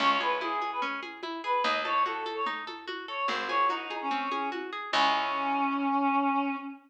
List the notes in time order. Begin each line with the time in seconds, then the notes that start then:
0.00 C#2 C#4 C#5, crash, low conga
0.10 C#5
0.20 G#4 B4, high conga
0.41 E4 G#4, high conga
0.61 G#4, high conga
0.72 B4
0.82 C#4, low conga
1.03 G#4, high conga
1.23 E4, high conga
1.44 G#4 B4
1.64 D#2 D#4 D#5, low conga
1.75 D#5
1.85 A4 C#5, high conga
2.05 F#4 A4, high conga
2.26 A4, high conga
2.36 C#5
2.46 D#4, low conga
2.67 A4, high conga
2.88 F#4, high conga
3.08 A4 C#5
3.28 G#1 C4 C5, low conga
3.38 C5
3.48 G#4 C#5, high conga
3.69 D#4 F#4, high conga
3.90 G#4, high conga
4.01 C#4
4.11 C4, low conga
4.32 G#4, high conga
4.52 F#4, high conga
4.73 G#4
4.92 C#2 C#4 E4 G#4, kick, crash